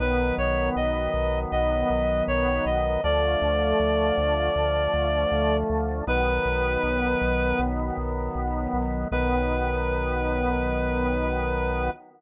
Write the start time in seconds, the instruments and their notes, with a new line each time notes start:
0.00 synth bass 1 B1, drawbar organ D#3 F#3 B3, clarinet B4
0.38 synth bass 1 B1, clarinet C#5
0.76 synth bass 1 B1, clarinet D#5
1.14 synth bass 1 B1
1.52 synth bass 1 B1, clarinet D#5
1.90 synth bass 1 B1
2.28 synth bass 1 B1, clarinet C#5
2.66 synth bass 1 B1, clarinet D#5
3.04 synth bass 1 D2, drawbar organ D3 F3 A3, clarinet D5
3.42 synth bass 1 D2
3.80 synth bass 1 D2
4.18 synth bass 1 D2
4.56 synth bass 1 D2
4.94 synth bass 1 D2
5.31 synth bass 1 D2
5.70 synth bass 1 D2
6.07 synth bass 1 B1, drawbar organ D#3 F#3 B3, clarinet B4
6.45 synth bass 1 B1
6.83 synth bass 1 B1
7.22 synth bass 1 B1
7.59 synth bass 1 B1
7.97 synth bass 1 B1
8.35 synth bass 1 B1
8.73 synth bass 1 B1
9.11 synth bass 1 B1, drawbar organ D#3 F#3 B3, clarinet B4